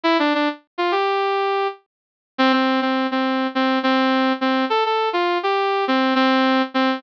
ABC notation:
X:1
M:4/4
L:1/16
Q:1/4=103
K:Dm
V:1 name="Brass Section"
E D D z2 F G6 z4 | C C2 C2 C3 C2 C4 C2 | A A2 F2 G3 C2 C4 C2 |]